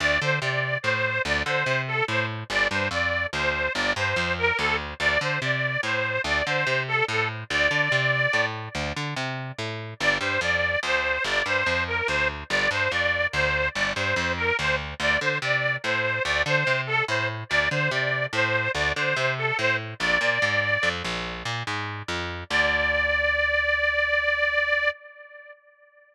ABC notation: X:1
M:12/8
L:1/8
Q:3/8=96
K:Dm
V:1 name="Harmonica"
d c d2 c2 d c2 A c z | d c d2 c2 d c2 B A z | d c d2 c2 d c2 A A z | d5 z7 |
d c d2 c2 d c2 B c z | d c d2 c2 d c2 B c z | d c d2 c2 d c2 A c z | d c d2 c2 d c2 A c z |
d5 z7 | d12 |]
V:2 name="Electric Bass (finger)" clef=bass
D,, D, C,2 A,,2 D,, D, C,2 A,,2 | G,,, G,, F,,2 D,,2 G,,, G,, F,,2 D,,2 | D,, D, C,2 A,,2 D,, D, C,2 A,,2 | D,, D, C,2 A,,2 D,, D, C,2 A,,2 |
G,,, G,, F,,2 D,,2 G,,, G,, F,,2 D,,2 | G,,, G,, F,,2 D,,2 G,,, G,, F,,2 D,,2 | D,, D, C,2 A,,2 D,, D, C,2 A,,2 | D,, D, C,2 A,,2 D,, D, C,2 A,,2 |
B,,, B,, _A,,2 F,, B,,,2 B,, A,,2 F,,2 | D,,12 |]